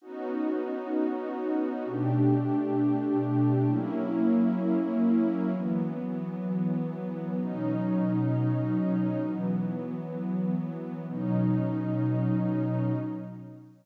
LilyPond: \new Staff { \time 4/4 \key b \major \tempo 4 = 130 <b cis' dis' fis'>1 | <b, a d' g'>1 | <fis ais cis' e'>1 | <e fis b>1 |
<b, fis cis' dis'>1 | <e fis b>1 | <b, fis cis' dis'>1 | }